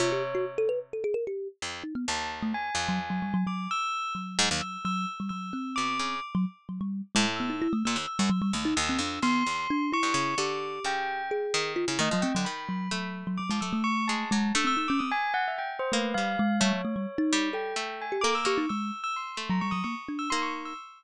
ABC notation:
X:1
M:9/8
L:1/16
Q:3/8=87
K:none
V:1 name="Kalimba"
F G z _G z A B z A _A _B =G2 z3 _E =B, | z3 A, z3 _G, z G, =G, _G, G,2 z4 | _G,6 G,2 z =G, _G,2 C6 | z _G, z2 G, =G,2 z _A, z B, _E =E =A, _B, z2 G, |
_G, =G, A, _E z C D2 B,2 z2 D2 =E4 | G8 _A4 F E =A, _G, C G, | z2 _G,2 G,3 G, G, _A, G, =A,5 _A,2 | D C _E _D C z7 A,2 G,2 _A,2 |
G, _G, A, =G, z _E3 A5 G A z G E | _A,2 z5 _G, =G, _G, _B, z D2 _E4 |]
V:2 name="Harpsichord"
C,10 z4 F,,2 z2 | _E,,6 F,,6 z6 | z2 _A,, _E,, z10 B,,2 _D,2 | z8 A,,5 z _B,, _E,, z _G,, |
z2 _E,,2 E,,2 F,,2 E,,2 =E,,2 z3 G,, _D,2 | D,4 _D,6 _E,3 D, E, F, A, =D, | _E,4 A,5 F, A,2 z2 _A,2 _G,2 | A,12 _B,2 G,2 z2 |
A,2 z4 G,4 A,4 _B,2 B,2 | z6 A,4 z4 _B,4 |]
V:3 name="Tubular Bells"
_d4 z14 | a2 z2 _a8 d'2 e'4 | z4 e'2 e'2 z2 e'4 d'4 | z10 e'4 e'2 e'2 |
e'4 e'4 c'6 _d'4 | d'4 g4 z6 _e2 g2 | b6 z2 d'2 e'2 _d'2 a4 | e' e' e' d' _e' _a2 _g =e =g z c B2 f4 |
_d8 g4 _a z =d' e' _d' z | e'3 e' c'3 _b _d' _e' d' z2 =e' c' d' z e' |]